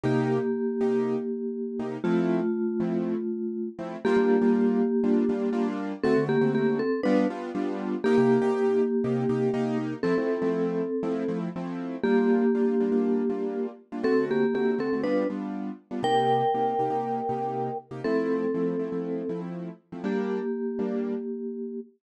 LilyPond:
<<
  \new Staff \with { instrumentName = "Vibraphone" } { \time 4/4 \key g \minor \tempo 4 = 120 <bes g'>1 | <a f'>2.~ <a f'>8 r8 | <bes g'>1 | <c' a'>8 <bes g'>8 <bes g'>8 <c' a'>8 <d' b'>8 r4. |
<bes g'>1 | <c' a'>2. r4 | <bes g'>1 | <c' a'>8 <bes g'>8 <bes g'>8 <c' a'>8 <d' b'>8 r4. |
<bes' g''>1 | <c' a'>2. r4 | <bes g'>1 | }
  \new Staff \with { instrumentName = "Acoustic Grand Piano" } { \time 4/4 \key g \minor <c bes ees' g'>4. <c bes ees' g'>2 <c bes ees' g'>8 | <f a c' e'>4. <f a c' e'>2 <f a c' e'>8 | <g bes d' f'>16 <g bes d' f'>8 <g bes d' f'>4~ <g bes d' f'>16 <g bes d' f'>8 <g bes d' f'>8 <g bes d' f'>4 | <d a c' fis'>16 <d a c' fis'>8 <d a c' fis'>4~ <d a c' fis'>16 <g b d' f'>8 <g b d' f'>8 <g b d' f'>4 |
<c bes ees' g'>16 <c bes ees' g'>8 <c bes ees' g'>4~ <c bes ees' g'>16 <c bes ees' g'>8 <c bes ees' g'>8 <c bes ees' g'>4 | <f a c' e'>16 <f a c' e'>8 <f a c' e'>4~ <f a c' e'>16 <f a c' e'>8 <f a c' e'>8 <f a c' e'>4 | <g bes d' f'>4 <g bes d' f'>8 <g bes d' f'>16 <g bes d' f'>8. <g bes d' f'>4~ <g bes d' f'>16 <g bes d' f'>16 | <d a c' fis'>4 <d a c' fis'>8 <d a c' fis'>16 <d a c' fis'>16 <g b d' f'>8 <g b d' f'>4~ <g b d' f'>16 <g b d' f'>16 |
<c bes ees' g'>4 <c bes ees' g'>8 <c bes ees' g'>16 <c bes ees' g'>8. <c bes ees' g'>4~ <c bes ees' g'>16 <c bes ees' g'>16 | <f a c' e'>4 <f a c' e'>8 <f a c' e'>16 <f a c' e'>8. <f a c' e'>4~ <f a c' e'>16 <f a c' e'>16 | <g bes d'>4. <g bes d'>2~ <g bes d'>8 | }
>>